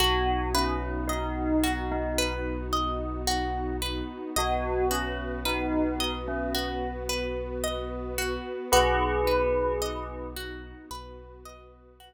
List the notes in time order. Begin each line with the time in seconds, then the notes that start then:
0.00 B1 B3 D#4 F#4
0.54 C#4 B4
1.07 D#4 D#5
1.64 F#4
1.91 D#4
2.18 B4
2.73 D#5
3.27 F#4
3.82 B4
4.36 B1 B3 F#4 B4 D#5
4.91 C#4 F#4
5.45 D#4 B4
6.00 D#5
6.28 C#4
6.55 F#4
7.09 B4
7.64 D#5
8.18 F#4
8.72 B1 B3 D#4 F#4 G#4 B4
9.27 B4
9.82 D#5
10.36 F#4
10.91 B1 B3 F#4 B4
11.45 D#5
12.00 F#4